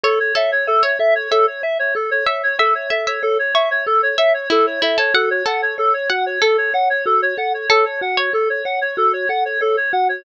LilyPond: <<
  \new Staff \with { instrumentName = "Clarinet" } { \time 4/4 \key a \major \tempo 4 = 94 a'16 cis''16 e''16 cis''16 a'16 cis''16 e''16 cis''16 a'16 cis''16 e''16 cis''16 a'16 cis''16 e''16 cis''16 | a'16 cis''16 e''16 cis''16 a'16 cis''16 e''16 cis''16 a'16 cis''16 e''16 cis''16 a'16 cis''16 e''16 cis''16 | a'16 cis''16 fis''16 cis''16 a'16 cis''16 fis''16 cis''16 a'16 cis''16 fis''16 cis''16 a'16 cis''16 fis''16 cis''16 | a'16 cis''16 fis''16 cis''16 a'16 cis''16 fis''16 cis''16 a'16 cis''16 fis''16 cis''16 a'16 cis''16 fis''16 cis''16 | }
  \new Staff \with { instrumentName = "Pizzicato Strings" } { \time 4/4 \key a \major cis''16 r16 a'8. cis''16 r8 e''8 r4 e''8 | e''8 e''16 e''16 r8 cis''8 r8 e''8 e'8 e'16 a'16 | fis''8 a'4 fis''8 a'2 | a'8. cis''4~ cis''16 r2 | }
  \new Staff \with { instrumentName = "Marimba" } { \time 4/4 \key a \major a'8 cis''8 e''8 a'8 cis''8 e''8 a'8 cis''8 | e''8 a'8 cis''8 e''8 a'8 cis''8 e''8 a'8 | fis'8 a'8 cis''8 fis'8 a'8 cis''8 fis'8 a'8 | cis''8 fis'8 a'8 cis''8 fis'8 a'8 cis''8 fis'8 | }
>>